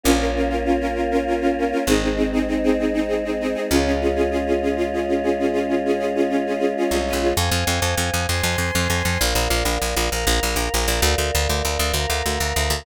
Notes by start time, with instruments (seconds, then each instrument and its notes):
0.03 electric bass (finger) A#1, choir aahs A#3 C#4 F4, string ensemble 1 C#4 F4 A#4
0.19 string ensemble 1 C#4 F4 A#4
0.35 string ensemble 1 C#4 F4 A#4
0.49 string ensemble 1 C#4 F4 A#4
0.65 string ensemble 1 C#4 F4 A#4
0.80 string ensemble 1 C#4 F4 A#4
0.95 string ensemble 1 C#4 F4 A#4
1.11 string ensemble 1 C#4 F4 A#4
1.27 string ensemble 1 C#4 F4 A#4
1.41 string ensemble 1 C#4 F4 A#4
1.58 string ensemble 1 C#4 F4 A#4
1.72 string ensemble 1 C#4 F4 A#4
1.87 electric bass (finger) G#1, choir aahs G#3 C4 D#4, string ensemble 1 C4 D#4 G#4
2.02 string ensemble 1 C4 D#4 G#4
2.16 string ensemble 1 C4 D#4 G#4
2.32 string ensemble 1 C4 D#4 G#4
2.48 string ensemble 1 C4 D#4 G#4
2.63 string ensemble 1 C4 D#4 G#4
2.79 string ensemble 1 C4 D#4 G#4
2.93 string ensemble 1 C4 D#4 G#4
3.08 string ensemble 1 C4 D#4 G#4
3.24 string ensemble 1 C4 D#4 G#4
3.40 string ensemble 1 C4 D#4 G#4
3.54 string ensemble 1 C4 D#4 G#4
3.70 electric bass (finger) C#2, choir aahs G#3 C#4 F4, string ensemble 1 C#4 F4 G#4
3.85 string ensemble 1 C#4 F4 G#4
4.01 string ensemble 1 C#4 F4 G#4
4.15 string ensemble 1 C#4 F4 G#4
4.31 string ensemble 1 C#4 F4 G#4
4.46 string ensemble 1 C#4 F4 G#4
4.62 string ensemble 1 C#4 F4 G#4
4.76 string ensemble 1 C#4 F4 G#4
4.93 string ensemble 1 C#4 F4 G#4
5.08 string ensemble 1 C#4 F4 G#4
5.23 string ensemble 1 C#4 F4 G#4
5.39 string ensemble 1 C#4 F4 G#4
5.53 string ensemble 1 C#4 F4 G#4
5.68 string ensemble 1 C#4 F4 G#4
5.85 string ensemble 1 C#4 F4 G#4
5.99 string ensemble 1 C#4 F4 G#4
6.15 string ensemble 1 C#4 F4 G#4
6.29 string ensemble 1 C#4 F4 G#4
6.46 string ensemble 1 C#4 F4 G#4
6.59 string ensemble 1 C#4 F4 G#4
6.77 string ensemble 1 C#4 F4 G#4
6.91 electric bass (finger) C2, string ensemble 1 C#4 F4 G#4
7.07 string ensemble 1 C#4 F4 G#4
7.13 electric bass (finger) B1
7.22 string ensemble 1 C#4 F4 G#4
7.36 electric bass (finger) F2, choir aahs C5 F5 G#5
7.51 electric bass (finger) F2
7.67 electric bass (finger) F2
7.82 electric bass (finger) F2
7.97 electric bass (finger) F2
8.14 electric bass (finger) F2
8.28 electric bass (finger) F2, choir aahs C5 G#5 C6
8.43 electric bass (finger) F2
8.58 electric bass (finger) F2
8.75 electric bass (finger) F2
8.90 electric bass (finger) F2
9.05 electric bass (finger) F2
9.19 electric bass (finger) A#1, choir aahs A#4 D5 F5
9.35 electric bass (finger) A#1
9.50 electric bass (finger) A#1
9.65 electric bass (finger) A#1
9.82 electric bass (finger) A#1
9.96 electric bass (finger) A#1
10.11 electric bass (finger) A#1, choir aahs A#4 F5 A#5
10.27 electric bass (finger) A#1
10.43 electric bass (finger) A#1
10.56 electric bass (finger) A#1
10.74 electric bass (finger) A#1
10.88 electric bass (finger) A#1
11.02 electric bass (finger) D2, choir aahs A#4 D5 F5
11.18 electric bass (finger) D2
11.35 electric bass (finger) D2
11.49 electric bass (finger) D2
11.65 electric bass (finger) D2
11.79 electric bass (finger) D2
11.94 electric bass (finger) D2, choir aahs A#4 F5 A#5
12.10 electric bass (finger) D2
12.26 electric bass (finger) D2
12.40 electric bass (finger) D2
12.56 electric bass (finger) D2
12.70 electric bass (finger) D2